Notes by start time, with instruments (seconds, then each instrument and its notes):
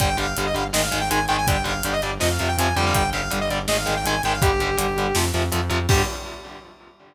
0.00 synth bass 1 G1, overdriven guitar D3 G3, lead 2 (sawtooth) G5, kick, closed hi-hat
0.17 synth bass 1 G1, overdriven guitar D3 G3, lead 2 (sawtooth) F5, closed hi-hat
0.37 synth bass 1 G1, overdriven guitar D3 G3, closed hi-hat
0.46 lead 2 (sawtooth) D#5
0.54 synth bass 1 G1, overdriven guitar D3 G3, lead 2 (sawtooth) F5, closed hi-hat
0.73 synth bass 1 G#1, overdriven guitar D#3 G#3, lead 2 (sawtooth) D#5, snare
0.83 lead 2 (sawtooth) F5
0.91 synth bass 1 G#1, overdriven guitar D#3 G#3, closed hi-hat
1.01 lead 2 (sawtooth) G5
1.11 synth bass 1 G#1, overdriven guitar D#3 G#3, lead 2 (sawtooth) G#5, closed hi-hat
1.28 synth bass 1 G#1, overdriven guitar D#3 G#3, lead 2 (sawtooth) G5, closed hi-hat
1.38 lead 2 (sawtooth) G#5
1.47 synth bass 1 G1, overdriven guitar D3 G3, lead 2 (sawtooth) G5, kick, closed hi-hat
1.64 synth bass 1 G1, overdriven guitar D3 G3, lead 2 (sawtooth) F5, closed hi-hat
1.83 synth bass 1 G1, overdriven guitar D3 G3, closed hi-hat
1.93 lead 2 (sawtooth) D#5
2.02 synth bass 1 G1, overdriven guitar D3 G3, lead 2 (sawtooth) D5, closed hi-hat
2.20 synth bass 1 F2, overdriven guitar C3 F3, lead 2 (sawtooth) D#5, snare
2.31 lead 2 (sawtooth) F5
2.39 synth bass 1 F2, overdriven guitar C3 F3, closed hi-hat
2.48 lead 2 (sawtooth) G5
2.57 synth bass 1 F2, overdriven guitar C3 F3, lead 2 (sawtooth) G#5, closed hi-hat
2.76 synth bass 1 F2, overdriven guitar D3 G3, lead 2 (sawtooth) G5, closed hi-hat
2.86 lead 2 (sawtooth) F5
2.95 synth bass 1 G1, lead 2 (sawtooth) G5, kick, closed hi-hat
3.13 synth bass 1 G1, overdriven guitar D3 G3, lead 2 (sawtooth) F5, closed hi-hat
3.30 synth bass 1 G1, overdriven guitar D3 G3, closed hi-hat
3.41 lead 2 (sawtooth) D#5
3.50 synth bass 1 G1, overdriven guitar D3 G3, lead 2 (sawtooth) D5, closed hi-hat
3.68 synth bass 1 G#1, overdriven guitar D#3 G#3, lead 2 (sawtooth) D#5, snare
3.78 lead 2 (sawtooth) F5
3.86 synth bass 1 G#1, overdriven guitar D#3 G#3, closed hi-hat
3.96 lead 2 (sawtooth) G5
4.05 synth bass 1 G#1, overdriven guitar D#3 G#3, lead 2 (sawtooth) G#5, closed hi-hat
4.23 synth bass 1 G#1, overdriven guitar D#3 G#3, lead 2 (sawtooth) G5, closed hi-hat
4.33 lead 2 (sawtooth) F5
4.42 synth bass 1 G1, overdriven guitar D3 G3, lead 2 (sawtooth) G4, kick, closed hi-hat
4.60 synth bass 1 G1, overdriven guitar D3 G3, closed hi-hat
4.77 synth bass 1 G1, overdriven guitar D3 G3, closed hi-hat
4.96 synth bass 1 G1, overdriven guitar D3 G3, closed hi-hat
5.15 synth bass 1 F2, overdriven guitar C3 F3, snare
5.34 synth bass 1 F2, overdriven guitar C3 F3, closed hi-hat
5.52 synth bass 1 F2, overdriven guitar C3 F3, closed hi-hat
5.70 synth bass 1 F2, overdriven guitar C3 F3, closed hi-hat
5.89 synth bass 1 G2, overdriven guitar D3 G3, lead 2 (sawtooth) G4, kick, crash